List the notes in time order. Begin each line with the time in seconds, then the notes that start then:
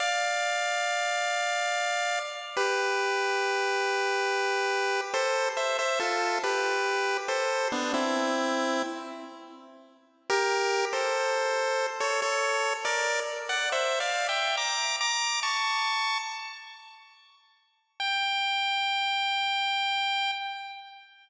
0.00 D5 F5
2.57 G4 B4
5.14 A4 C5
5.57 C5 E5
5.79 C5 E5
5.99 F4 A4
6.43 G4 B4
7.28 A4 C5
7.72 B3 D4
7.94 C4 E4
10.30 G4 A#4
10.93 A4 C5
12.00 A4 C#5
12.22 A4 C#5
12.85 A#4 D5
13.49 D5 F#5
13.72 C5 E5
14.00 D5 F5
14.29 E5 G5
14.57 A#5 D6
15.01 A#5 D6
15.43 A5 C#6
18.00 G5